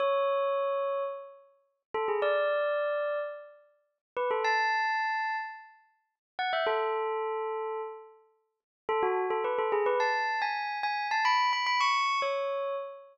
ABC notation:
X:1
M:4/4
L:1/16
Q:1/4=108
K:A
V:1 name="Tubular Bells"
c8 z6 A G | d8 z6 B A | a8 z6 f e | A10 z6 |
A F2 A B A G B a3 g3 g2 | a b2 b b c'3 c4 z4 |]